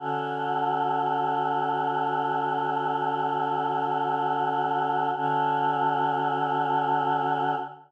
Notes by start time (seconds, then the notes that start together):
0.00 D3 C#4 F#4 A4
5.17 D3 C#4 F#4 A4